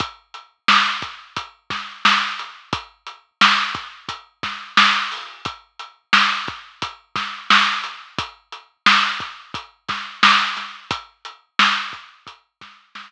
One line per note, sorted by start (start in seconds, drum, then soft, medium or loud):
0.00 kick loud
0.00 closed hi-hat medium
0.34 closed hi-hat medium
0.68 snare medium
1.02 kick medium
1.02 closed hi-hat medium
1.37 kick medium
1.37 closed hi-hat medium
1.70 kick medium
1.70 snare soft
1.70 closed hi-hat medium
2.05 snare medium
2.39 closed hi-hat medium
2.73 kick loud
2.73 closed hi-hat medium
3.07 closed hi-hat medium
3.41 snare loud
3.75 kick medium
3.75 closed hi-hat medium
4.09 kick medium
4.09 closed hi-hat medium
4.43 kick medium
4.43 snare soft
4.43 closed hi-hat medium
4.77 snare loud
5.12 open hi-hat medium
5.45 kick medium
5.45 closed hi-hat medium
5.79 closed hi-hat medium
6.13 snare medium
6.48 kick medium
6.48 closed hi-hat medium
6.82 kick medium
6.82 closed hi-hat medium
7.16 kick medium
7.16 snare medium
7.16 closed hi-hat medium
7.50 snare loud
7.84 closed hi-hat medium
8.18 kick loud
8.18 closed hi-hat loud
8.52 closed hi-hat medium
8.86 snare loud
9.20 kick medium
9.20 closed hi-hat medium
9.54 kick medium
9.54 closed hi-hat medium
9.88 kick medium
9.88 snare soft
9.88 closed hi-hat medium
10.23 snare loud
10.57 snare soft
10.57 closed hi-hat medium
10.91 kick medium
10.91 closed hi-hat loud
11.25 closed hi-hat medium
11.59 snare loud
11.93 kick medium
11.93 closed hi-hat medium
12.27 kick medium
12.27 closed hi-hat medium
12.61 kick medium
12.61 snare medium
12.61 closed hi-hat medium
12.95 snare medium